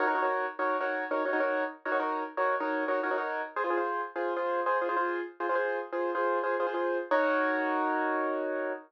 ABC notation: X:1
M:12/8
L:1/16
Q:3/8=135
K:Ebdor
V:1 name="Acoustic Grand Piano"
[EGBd] [EGBd] [EGBd] [EGBd]5 [EGBd]3 [EGBd]4 [EGBd]2 [EGBd] [EGBd] [EGBd]5- | [EGBd] [EGBd] [EGBd] [EGBd]5 [EGBd]3 [EGBd]4 [EGBd]2 [EGBd] [EGBd] [EGBd]5 | [FAc] [FAc] [FAc] [FAc]5 [FAc]3 [FAc]4 [FAc]2 [FAc] [FAc] [FAc]5- | [FAc] [FAc] [FAc] [FAc]5 [FAc]3 [FAc]4 [FAc]2 [FAc] [FAc] [FAc]5 |
[EGBd]24 |]